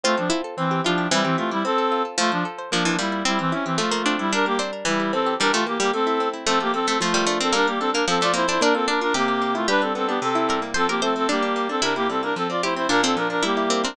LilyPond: <<
  \new Staff \with { instrumentName = "Clarinet" } { \time 2/2 \key f \major \tempo 2 = 112 <a f'>8 <f d'>8 r4 <e c'>4 <f d'>4 | <g e'>8 <e c'>8 <a f'>8 <g e'>8 <c' a'>4. r8 | <a f'>8 <f d'>8 r4 <f d'>4 <g e'>4 | <g e'>8 <e c'>8 des'8 <e c'>8 <a f'>4. <g e'>8 |
<d' bes'>8 <bes g'>8 r4 <g e'>4 <c' a'>4 | <d' bes'>8 <a f'>8 <bes g'>8 <bes g'>8 <c' a'>4. r8 | <c' a'>8 <bes g'>8 <c' a'>8 <c' a'>8 <a f'>4. <c' a'>8 | <d' bes'>8 <bes g'>8 <c' a'>8 <d' bes'>8 <c' a'>8 <f' d''>8 <e' c''>8 <e' c''>8 |
<d' bes'>8 <c' a'>8 <d' bes'>8 <d' bes'>8 <bes g'>4. <a f'>8 | <d' b'>8 <c' a'>8 <c' a'>8 <b g'>8 <c' a'>4. r8 | <c' a'>8 <bes g'>8 <c' a'>8 <c' a'>8 <bes g'>4. <c' a'>8 | <d' bes'>8 <bes g'>8 <c' a'>8 <d' bes'>8 <c' a'>8 <f' d''>8 <e' c''>8 <e' c''>8 |
<d' bes'>8 <c' a'>8 <d' bes'>8 <d' bes'>8 <bes g'>4. <d' bes'>8 | }
  \new Staff \with { instrumentName = "Harpsichord" } { \time 2/2 \key f \major f'4 e'8 r4. f'4 | e2 r2 | f2 f8 e8 g4 | c'2 a8 bes8 d'4 |
d'4 c'8 r8 e4. r8 | g8 a8 r8 g8 r2 | a4. a8 f8 g8 a8 c'8 | bes4. bes8 f8 a8 bes8 d'8 |
d'8 r8 d'4 g'2 | g'2. bes'4 | c''8 bes'8 c''4 d'2 | e'2. g'4 |
d'8 c'8 r4 e'4 c'8 c'8 | }
  \new Staff \with { instrumentName = "Acoustic Guitar (steel)" } { \time 2/2 \key f \major c'8 a'8 f'8 a'8 c'8 g'8 e'8 g'8 | c'8 g'8 e'8 g'8 c'8 a'8 f'8 a'8 | f'8 c''8 a'8 c''8 bes8 d''8 f'8 d''8 | c'8 g'8 e'8 g'8 f8 a'8 c'8 a'8 |
g8 bes'8 d'8 bes'8 e8 g'8 c'8 g'8 | e8 g'8 bes8 g'8 a8 e'8 c'8 e'8 | f8 a'8 c'8 a'8 f8 bes'8 d'8 bes'8 | g8 bes'8 d'8 bes'8 f8 a'8 c'8 a'8 |
bes8 f'8 d'8 f'8 c8 g'8 bes8 e'8 | g8 d'8 b8 d'8 c8 e'8 g8 bes8 | f8 c'8 a8 c'8 g8 d'8 bes8 d'8 | c8 e'8 g8 bes8 f8 c'8 a8 c'8 |
bes,8 d'8 f8 d'8 g8 e'8 bes8 c'8 | }
>>